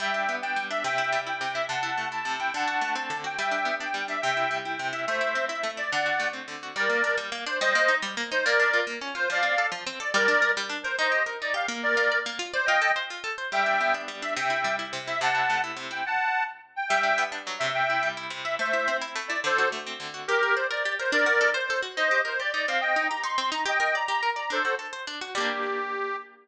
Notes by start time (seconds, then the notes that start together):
0.00 G3 E5 G5
0.14 D4
0.29 B3
0.42 D4 G5
0.56 G3
0.70 D4 E5
0.84 C3 E5 G5
0.98 E4
1.12 G3
1.27 E4 G5
1.41 C3
1.54 E4 E5
1.68 C3 F#5 A5
1.83 E4
1.98 A3
2.12 E4 A5
2.25 C3
2.39 E4 G5
2.54 D3 F#5 A5
2.68 F#4
2.81 A3
2.95 C4 A5
3.10 D3
3.24 F#4 G5
3.38 G3 E5 G5
3.51 D4
3.65 B3
3.80 D4 G5
3.94 G3
4.08 D4 E5
4.22 C3 E5 G5
4.37 E4
4.51 G3
4.65 E4 G5
4.79 C3
4.93 E4 E5
5.07 A3 C5 E5
5.21 E4
5.35 C4
5.48 E4 E5
5.63 A3
5.77 E4 D5
5.92 D3 D5 F#5
6.06 F#4
6.20 A3
6.33 C4
6.48 D3
6.63 F#4
6.75 G3 A#4 D5
6.89 A#3
7.04 D4
7.17 G3
7.32 A#3
7.46 D4 C5
7.61 G3 C5 D#5
7.75 A#3
7.88 D#4
8.02 G3
8.17 A#3
8.32 D#4 C5
8.45 A#3 A#4 D5
8.60 D4
8.73 F4
8.87 A#3
9.01 C#4
9.15 F4 C5
9.30 F3 D5 F5
9.43 C4
9.58 A4
9.72 F3
9.87 C4
10.00 A4 D5
10.14 G3 A#4 D5
10.28 D4
10.42 A#4
10.57 G3
10.69 D4
10.83 A#4 C5
10.99 D#4 C5 D#5
11.12 G4
11.26 A#4
11.42 D#4 D5
11.54 G4 F5
11.68 A#3
11.83 A#4 D5
11.97 F4
12.12 D5
12.26 A#3
12.39 F4
12.53 C5 D5
12.66 F4 D#5 G5
12.82 A4
12.96 C5
13.10 F4
13.24 A4
13.38 C5
13.52 G3 E5 G5
13.66 D4
13.81 B3
13.94 D4
14.08 G3
14.22 D4 E5
14.37 C3 E5 G5
14.50 E4
14.64 G3
14.79 E4
14.93 C3
15.07 E4 E5
15.21 C3 F#5 A5
15.35 E4
15.50 A3
15.64 E4
15.77 C3
15.91 E4 G5
16.06 F#5 A5
16.76 G5
16.89 G3 E5 G5
17.03 D4
17.18 B3
17.32 D4
17.47 F#3
17.59 C3 E5
17.74 E5 G5
17.90 E4
18.03 G3
18.17 E4
18.30 C3
18.44 E4 E5
18.59 A3 C5 E5
18.73 E4
18.88 C4
19.01 E4
19.15 A3
19.28 E4 D5
19.44 D3 A4 C5
19.58 F#4
19.72 A3
19.87 C4
20.00 D3
20.14 F#4
20.28 G4 A#4
20.43 A#4
20.55 C5 D5
20.71 A#4 D5
20.85 G4
20.99 A#4 C5
21.12 D4 A#4 D5
21.26 F#4
21.41 A4
21.54 C5
21.70 A4
21.82 F#4
21.97 D#4 C5 D#5
22.11 G4
22.25 A#4 C5
22.40 G4 D5
22.54 D#4 D5
22.68 C4 F5
22.81 D#5 G5
22.96 D#4
23.09 G4 A#5
23.24 D#4 C6
23.38 C4
23.52 D#4 A#5
23.65 G4 D#5 G5
23.80 A#4
23.95 D5 A#5
24.08 G4 A#5
24.23 A#4
24.36 D5 A#5
24.50 D4 A4 C5
24.65 F#4
24.79 A4
24.93 C5
25.07 D4
25.21 F#4
25.35 G3 A#3 G4
25.40 D4